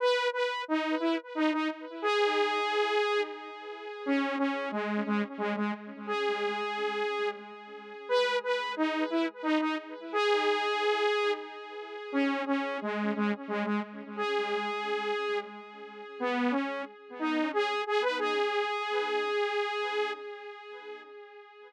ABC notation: X:1
M:3/4
L:1/16
Q:1/4=89
K:G#m
V:1 name="Lead 2 (sawtooth)"
B2 B2 D2 E z D D z2 | G8 z4 | C2 C2 G,2 G, z G, G, z2 | G8 z4 |
B2 B2 D2 E z D D z2 | G8 z4 | C2 C2 G,2 G, z G, G, z2 | G8 z4 |
B,2 C2 z2 D2 G2 G B | G12 |]